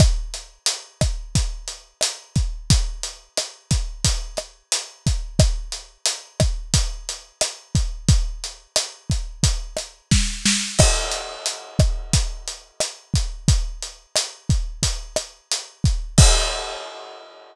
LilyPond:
\new DrumStaff \drummode { \time 4/4 \tempo 4 = 89 <hh bd ss>8 hh8 hh8 <hh bd ss>8 <hh bd>8 hh8 <hh ss>8 <hh bd>8 | <hh bd>8 hh8 <hh ss>8 <hh bd>8 <hh bd>8 <hh ss>8 hh8 <hh bd>8 | <hh bd ss>8 hh8 hh8 <hh bd ss>8 <hh bd>8 hh8 <hh ss>8 <hh bd>8 | <hh bd>8 hh8 <hh ss>8 <hh bd>8 <hh bd>8 <hh ss>8 <bd sn>8 sn8 |
<cymc bd ss>8 hh8 hh8 <hh bd ss>8 <hh bd>8 hh8 <hh ss>8 <hh bd>8 | <hh bd>8 hh8 <hh ss>8 <hh bd>8 <hh bd>8 <hh ss>8 hh8 <hh bd>8 | <cymc bd>4 r4 r4 r4 | }